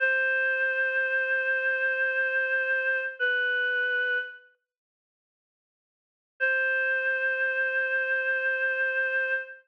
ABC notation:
X:1
M:4/4
L:1/8
Q:1/4=75
K:Cm
V:1 name="Choir Aahs"
c8 | =B3 z5 | c8 |]